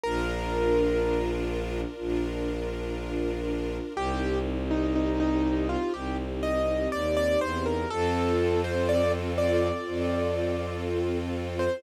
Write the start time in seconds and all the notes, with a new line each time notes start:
0.03 A#1 D4 F4 A#4
1.99 A#1 D4 F4 A#4
3.95 C2 C4 D#4 G4
4.71 D#4
4.95 D#4
5.20 D#4
5.69 F4
5.94 C2 G4
6.43 D#5
6.92 D#2 D5
7.17 D5
7.41 E2 C5
7.66 A#4
7.90 F2 C4 F4 A4
8.64 C5
8.89 D5
9.38 D5
9.87 F2 C4 F4 A4
11.59 C5